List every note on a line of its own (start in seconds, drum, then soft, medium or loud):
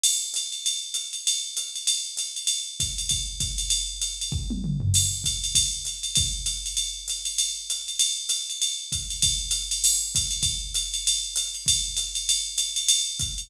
0.04 crash medium
0.04 ride medium
0.34 hi-hat pedal medium
0.34 ride medium
0.52 ride medium
0.66 ride medium
0.94 hi-hat pedal medium
0.94 ride medium
1.13 ride medium
1.27 ride medium
1.57 hi-hat pedal medium
1.57 ride medium
1.76 ride medium
1.87 ride medium
2.17 hi-hat pedal medium
2.17 ride medium
2.36 ride medium
2.47 ride medium
2.80 kick medium
2.80 hi-hat pedal medium
2.80 ride medium
2.98 ride medium
3.09 kick soft
3.09 ride medium
3.40 kick medium
3.40 hi-hat pedal medium
3.40 ride medium
3.58 ride medium
3.70 ride medium
4.02 hi-hat pedal medium
4.02 ride medium
4.21 ride medium
4.32 kick medium
4.50 high tom medium
4.64 mid tom medium
4.80 floor tom medium
4.94 crash medium
4.94 ride medium
5.24 kick soft
5.24 hi-hat pedal medium
5.24 ride medium
5.44 ride medium
5.55 kick soft
5.55 ride loud
5.85 hi-hat pedal medium
5.85 ride medium
6.03 ride medium
6.15 kick medium
6.15 ride medium
6.46 hi-hat pedal medium
6.46 ride medium
6.66 ride medium
6.77 ride medium
7.08 hi-hat pedal medium
7.08 ride medium
7.25 ride medium
7.38 ride medium
7.70 hi-hat pedal medium
7.70 ride medium
7.88 ride medium
7.99 ride loud
8.29 hi-hat pedal medium
8.29 ride medium
8.50 ride medium
8.62 ride medium
8.92 kick soft
8.92 hi-hat pedal medium
8.92 ride medium
9.10 ride medium
9.22 kick medium
9.22 ride loud
9.51 hi-hat pedal medium
9.51 ride medium
9.71 ride medium
9.84 crash loud
9.84 ride medium
10.15 kick medium
10.15 hi-hat pedal medium
10.15 ride medium
10.31 ride medium
10.43 kick medium
10.43 ride medium
10.74 hi-hat pedal medium
10.74 ride medium
10.94 ride medium
11.07 ride medium
11.36 hi-hat pedal medium
11.36 ride medium
11.55 ride medium
11.66 kick soft
11.66 ride loud
11.97 hi-hat pedal medium
11.97 ride medium
12.15 ride medium
12.29 ride medium
12.58 hi-hat pedal medium
12.58 ride medium
12.76 ride medium
12.88 ride loud
13.19 kick medium
13.19 hi-hat pedal medium
13.19 ride medium
13.38 ride medium